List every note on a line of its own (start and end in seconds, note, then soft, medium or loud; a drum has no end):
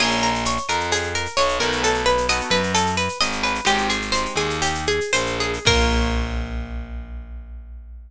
0.00 0.58 A#1 loud
0.00 0.31 A#3 medium
0.00 0.31 C#4 medium
0.00 0.31 F4 medium
0.00 0.31 G#4 medium
0.00 0.21 G#4 medium
0.00 crash medium
0.00 cowbell loud
0.00 claves loud
0.11 shaker medium
0.23 0.44 A#4 medium
0.23 shaker medium
0.35 shaker medium
0.45 0.67 C#5 medium
0.45 shaker loud
0.57 shaker medium
0.68 1.27 F2 medium
0.68 0.90 A#4 medium
0.68 claves medium
0.68 shaker medium
0.80 shaker medium
0.91 1.13 G#4 medium
0.91 cowbell medium
0.91 shaker loud
1.03 shaker medium
1.15 1.36 A#4 medium
1.15 shaker medium
1.26 shaker medium
1.37 1.59 B1 medium
1.37 1.58 C#5 medium
1.37 cowbell medium
1.37 claves medium
1.37 shaker medium
1.49 shaker medium
1.60 2.41 B1 loud
1.60 2.17 A3 medium
1.60 2.17 B3 medium
1.60 2.17 D#4 medium
1.60 2.17 F#4 medium
1.60 1.81 A#4 medium
1.60 cowbell medium
1.60 shaker medium
1.72 shaker medium
1.83 2.05 A4 medium
1.83 cowbell medium
1.83 shaker loud
1.94 shaker medium
2.06 2.27 B4 medium
2.06 shaker medium
2.18 shaker medium
2.29 2.61 A3 medium
2.29 2.61 B3 medium
2.29 2.61 D#4 medium
2.29 2.61 F#4 medium
2.29 2.50 D#5 medium
2.29 claves loud
2.29 shaker loud
2.41 shaker medium
2.50 3.09 F#2 medium
2.50 2.72 B4 medium
2.50 shaker medium
2.63 shaker medium
2.74 2.96 A4 medium
2.74 cowbell medium
2.74 claves medium
2.74 shaker loud
2.86 shaker medium
2.97 3.18 B4 medium
2.97 shaker medium
3.09 shaker medium
3.21 3.60 G#1 medium
3.21 3.42 D#5 medium
3.21 cowbell medium
3.21 shaker medium
3.32 shaker medium
3.43 3.65 B4 medium
3.43 cowbell medium
3.43 shaker medium
3.55 shaker medium
3.65 4.26 G#1 loud
3.65 3.98 G#3 medium
3.65 3.98 C4 medium
3.65 3.98 D#4 medium
3.65 3.98 G4 medium
3.65 3.88 G4 medium
3.65 cowbell medium
3.65 claves loud
3.65 shaker medium
3.78 shaker medium
3.89 4.11 G#4 medium
3.89 shaker medium
4.02 shaker medium
4.12 4.47 G#3 medium
4.12 4.47 C4 medium
4.12 4.47 D#4 medium
4.12 4.47 G4 medium
4.12 4.34 C5 medium
4.12 shaker medium
4.26 shaker medium
4.36 5.00 D#2 medium
4.36 4.60 G#4 medium
4.36 claves medium
4.36 shaker medium
4.50 shaker medium
4.62 4.85 G4 medium
4.62 cowbell medium
4.62 shaker loud
4.75 shaker medium
4.87 5.12 G#4 medium
4.87 shaker medium
5.01 shaker medium
5.13 5.59 A#1 medium
5.13 5.37 C5 medium
5.13 cowbell medium
5.13 claves medium
5.13 shaker loud
5.26 shaker medium
5.40 5.65 G#4 medium
5.40 cowbell medium
5.40 shaker medium
5.53 shaker medium
5.65 8.10 A#1 loud
5.65 8.11 A#3 medium
5.65 8.11 C#4 loud
5.65 8.11 F4 loud
5.65 8.11 G#4 medium
5.65 8.11 A#4 loud
5.65 kick loud
5.65 crash loud